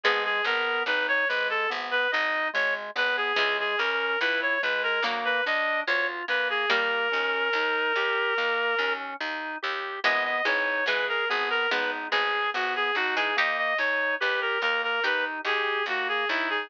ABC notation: X:1
M:4/4
L:1/16
Q:1/4=72
K:G#m
V:1 name="Clarinet"
G G A2 B c B =A z B d2 c z B G | G G A2 B c B A z B d2 c z B G | A12 z4 | d d c2 B A G A B z G2 F G F G |
d d c2 B A A A B z G2 F G E G |]
V:2 name="Harpsichord"
[G,B,]10 z6 | [E,G,]8 [F,A,]8 | [=G,A,]12 z4 | [E,G,]2 [E,G,]2 [E,G,]4 [G,B,]2 [G,B,]2 z3 [E,G,] |
[D=G]8 [GA]8 |]
V:3 name="Drawbar Organ"
G,2 B,2 D2 G,2 B,2 D2 G,2 B,2 | G,2 C2 E2 G,2 A,2 =D2 ^E2 A,2 | A,2 C2 D2 =G2 A,2 C2 D2 G2 | B,2 D2 G2 B,2 D2 G2 B,2 D2 |
A,2 D2 =G2 A,2 D2 G2 A,2 D2 |]
V:4 name="Electric Bass (finger)" clef=bass
G,,,2 G,,,2 G,,,2 G,,,2 G,,,2 G,,,2 G,,,2 G,,,2 | C,,2 C,,2 C,,2 C,,2 =D,,2 D,,2 D,,2 D,,2 | D,,2 D,,2 D,,2 D,,2 D,,2 D,,2 D,,2 D,,2 | G,,,2 G,,,2 G,,,2 G,,,2 G,,,2 G,,,2 G,,,2 G,,,2 |
D,,2 D,,2 D,,2 D,,2 D,,2 D,,2 D,,2 D,,2 |]